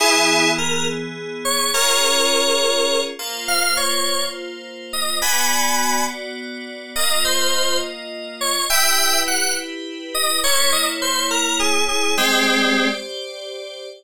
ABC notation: X:1
M:6/8
L:1/16
Q:3/8=69
K:Ebdor
V:1 name="Electric Piano 2"
[_FA]4 B2 z4 d2 | [Bd]10 z2 | f2 d4 z4 e2 | [a=b]6 z6 |
e2 c4 z4 d2 | [=e=g]4 _g2 z4 _e2 | d2 e z c2 B2 A2 A2 | [A,C]6 z6 |]
V:2 name="Electric Piano 2"
[_F,_CA]12 | [DFA]10 [B,Fc]2- | [B,Fc]12 | [=B,^F=d]12 |
[B,Fe]12 | [=E=G=B]12 | [B,_Fd]12 | [=Gc=d]12 |]